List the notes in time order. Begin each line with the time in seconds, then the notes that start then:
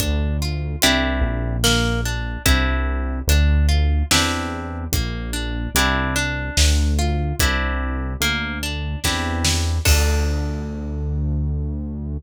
0.00 D2 D4, kick, closed hi-hat
0.42 F4
0.82 C2 C4 D4 E4 G4, closed hi-hat
1.21 A#1
1.64 A#3, snare
2.05 D4
2.46 C2 C4 D4 E4 G4, kick, closed hi-hat
3.27 D2 D4, closed hi-hat
3.69 F4
4.11 E2 C4 D4 E4 G4, snare
4.92 A#1 A#3, kick, closed hi-hat
5.33 D4
5.75 C2 C4 D4 E4 G4, closed hi-hat
6.16 D4
6.57 D2, snare
6.99 F4
7.39 C2 C4 D4 E4 G4, kick, closed hi-hat
8.20 D2 A#3, closed hi-hat
8.63 D4
9.04 E2 C4 D4 E4 G4, kick, snare
9.45 snare
9.85 D2 D4 F4 A4, kick, crash